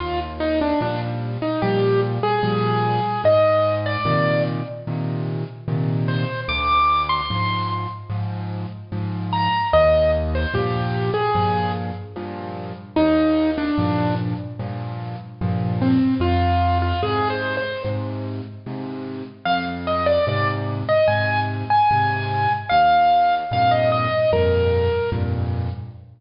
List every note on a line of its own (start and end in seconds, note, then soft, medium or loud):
0.00 0.73 D#2 medium
0.00 0.19 F4 medium
0.40 0.59 D#4 medium
0.61 0.81 D4 medium
0.81 1.38 A#2 medium
0.81 1.38 F3 medium
0.81 1.38 G3 medium
0.81 1.01 D4 medium
1.42 1.61 D#4 medium
1.62 2.19 A#2 medium
1.62 2.19 F3 medium
1.62 2.19 G3 medium
1.62 2.01 G4 medium
2.23 3.22 G#4 medium
2.43 3.00 A#2 medium
2.43 3.00 F3 medium
2.43 3.00 G3 medium
3.24 3.97 G#2 medium
3.24 3.75 D#5 medium
3.86 4.43 D5 medium
4.05 4.62 A#2 medium
4.05 4.62 C3 medium
4.05 4.62 D#3 medium
4.87 5.44 A#2 medium
4.87 5.44 C3 medium
4.87 5.44 D#3 medium
5.68 6.25 A#2 medium
5.68 6.25 C3 medium
5.68 6.25 D#3 medium
6.08 6.41 C5 medium
6.48 7.21 D2 loud
6.48 7.02 D6 medium
7.09 7.68 C6 medium
7.30 7.87 G#2 medium
7.30 7.87 F3 medium
8.10 8.66 G#2 medium
8.10 8.66 F3 medium
8.92 9.49 G#2 medium
8.92 9.49 F3 medium
9.33 9.68 A#5 medium
9.73 10.46 D#2 loud
9.73 10.11 D#5 medium
10.35 10.54 C5 medium
10.54 11.10 G2 medium
10.54 11.10 A#2 medium
10.54 11.10 F3 medium
10.54 11.11 G4 medium
11.14 11.72 G#4 medium
11.35 11.92 G2 medium
11.35 11.92 A#2 medium
11.35 11.92 F3 medium
12.16 12.73 G2 medium
12.16 12.73 A#2 medium
12.16 12.73 F3 medium
12.96 13.70 D#2 medium
12.96 13.51 D#4 medium
13.58 14.15 D4 medium
13.78 14.35 G2 medium
13.78 14.35 A#2 medium
13.78 14.35 F3 medium
14.59 15.16 G2 medium
14.59 15.16 A#2 medium
14.59 15.16 F3 medium
15.41 15.98 G2 medium
15.41 15.98 A#2 medium
15.41 15.98 F3 medium
15.82 16.14 C4 medium
16.20 16.93 F2 medium
16.20 16.78 F4 medium
16.82 17.01 F4 medium
17.03 17.59 G#2 medium
17.03 17.59 C3 medium
17.03 17.28 G#4 medium
17.30 17.56 C5 medium
17.57 17.83 C5 medium
17.84 18.41 G#2 medium
17.84 18.41 C3 medium
18.66 19.23 G#2 medium
18.66 19.23 C3 medium
19.45 20.19 F2 medium
19.45 19.65 F5 medium
19.87 20.06 D#5 medium
20.06 20.26 D5 medium
20.27 20.84 G#2 medium
20.27 20.84 C3 medium
20.27 20.48 D5 medium
20.89 21.08 D#5 medium
21.08 21.65 G#2 medium
21.08 21.65 C3 medium
21.08 21.40 G#5 medium
21.70 22.53 G#5 medium
21.91 22.48 G#2 medium
21.91 22.48 C3 medium
22.69 23.44 D#2 medium
22.69 23.35 F5 medium
23.51 24.08 F2 medium
23.51 24.08 G2 medium
23.51 24.08 A#2 medium
23.51 23.72 F5 medium
23.71 23.91 D#5 medium
23.92 24.31 D#5 medium
24.32 24.89 F2 medium
24.32 24.89 G2 medium
24.32 24.89 A#2 medium
24.32 25.10 A#4 medium
25.12 25.69 F2 medium
25.12 25.69 G2 medium
25.12 25.69 A#2 medium